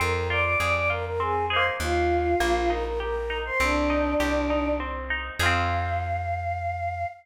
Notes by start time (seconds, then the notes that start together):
0.00 F2 C4 A#4 A#5
0.29 F4 D5 D6
0.44 D5 D6
0.60 F2 G#4 D5 D6
0.74 D5 D6
0.90 F4 A#4 A#5
1.06 A#4 A#5
1.20 C4 G#4 G#5
1.50 D#4 G#4 C5 C6
1.56 A#3
1.80 D#2 F4 F5
2.40 A#1 A#3
2.70 D#4 A#4 A#5
2.85 A#4 A#5
3.00 G4 A#4 A#5
3.30 D#4
3.45 C5 C6
3.60 C2 C4 D4 D5
3.90 D#4
4.20 C2 G4
4.50 D#4
4.80 C4
5.10 D#4
5.39 F2 F4 G#4 F5
5.46 C4